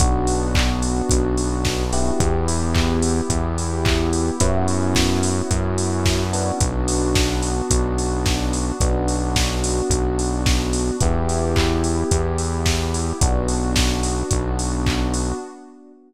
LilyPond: <<
  \new Staff \with { instrumentName = "Electric Piano 1" } { \time 4/4 \key b \minor \tempo 4 = 109 <b d' fis'>2.~ <b d' fis'>8 <b e' g'>8~ | <b e' g'>1 | <b cis' e' fis'>2.~ <b cis' e' fis'>8 <b d' fis'>8~ | <b d' fis'>1 |
<b d' fis'>1 | <b e' g'>1 | <b d' fis'>1 | }
  \new Staff \with { instrumentName = "Synth Bass 1" } { \clef bass \time 4/4 \key b \minor b,,2 b,,2 | e,2 e,2 | fis,2 fis,2 | b,,2 b,,2 |
b,,2 b,,2 | e,2 e,2 | b,,2 b,,2 | }
  \new Staff \with { instrumentName = "Pad 2 (warm)" } { \time 4/4 \key b \minor <b d' fis'>1 | <b e' g'>1 | <b cis' e' fis'>1 | <b d' fis'>1 |
<b d' fis'>1 | <b e' g'>1 | <b d' fis'>1 | }
  \new DrumStaff \with { instrumentName = "Drums" } \drummode { \time 4/4 <hh bd>8 hho8 <hc bd>8 hho8 <hh bd>8 hho8 <bd sn>8 hho8 | <hh bd>8 hho8 <hc bd>8 hho8 <hh bd>8 hho8 <hc bd>8 hho8 | <hh bd>8 hho8 <bd sn>8 hho8 <hh bd>8 hho8 <bd sn>8 hho8 | <hh bd>8 hho8 <bd sn>8 hho8 <hh bd>8 hho8 <bd sn>8 hho8 |
<hh bd>8 hho8 <bd sn>8 hho8 <hh bd>8 hho8 <bd sn>8 hho8 | <hh bd>8 hho8 <hc bd>8 hho8 <hh bd>8 hho8 <bd sn>8 hho8 | <hh bd>8 hho8 <bd sn>8 hho8 <hh bd>8 hho8 <hc bd>8 hho8 | }
>>